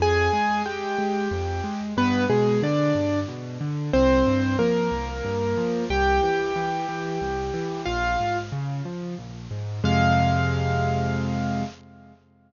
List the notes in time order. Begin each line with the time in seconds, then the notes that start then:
0.00 F2 G#4 G#5
0.33 G#3
0.66 G#3 G4 G5
0.98 G#3
1.31 F2
1.64 G#3
1.97 G2 B3 B4
2.30 B2 G#3 G#4
2.62 D3 D4 D5
2.95 G2
3.28 B2
3.61 D3
3.93 C2 C4 C5
4.26 G2
4.59 F3 A#3 A#4
4.92 C2
5.25 G2
5.57 F3
5.90 C2 G4 G5
6.23 E3
6.56 E3
6.89 E3
7.21 C2
7.54 E3
7.86 A#1 F4 F5
8.20 G#2
8.52 C#3
8.85 F3
9.18 A#1
9.51 G#2
9.84 F2 C3 G#3 F5